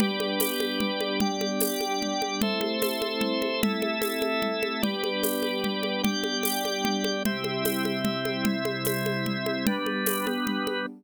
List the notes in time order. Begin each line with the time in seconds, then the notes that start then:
0.00 G3 B3 D4 G4 B4 D5, low conga
0.20 high conga
0.40 tambourine, high conga
0.60 high conga
0.80 low conga
1.01 high conga
1.20 G4 D5 G5, low conga
1.41 high conga
1.60 tambourine, high conga
1.81 high conga
2.02 low conga
2.22 high conga
2.42 A3 C4 E4 A4 C5 E5, low conga
2.61 high conga
2.82 tambourine, high conga
3.02 high conga
3.21 low conga
3.42 high conga
3.63 E4 A4 E5, low conga
3.82 high conga
4.02 tambourine, high conga
4.22 high conga
4.42 low conga
4.63 high conga
4.82 G3 B3 D4 G4 B4 D5, low conga
5.04 high conga
5.23 tambourine, high conga
5.43 high conga
5.64 low conga
5.83 high conga
6.03 G4 D5 G5, low conga
6.24 high conga
6.43 tambourine, high conga
6.65 high conga
6.85 low conga
7.04 high conga
7.25 C3 G3 C4 E4 G4 E5, low conga
7.44 high conga
7.65 tambourine, high conga
7.85 high conga
8.05 low conga
8.25 high conga
8.45 C4 E4 E5, low conga
8.65 high conga
8.85 tambourine, high conga
9.06 high conga
9.26 low conga
9.46 high conga
9.67 G3 B3 D4 B4, low conga
9.86 high conga
10.06 tambourine, high conga
10.26 G3 B3 B4, high conga
10.47 low conga
10.67 high conga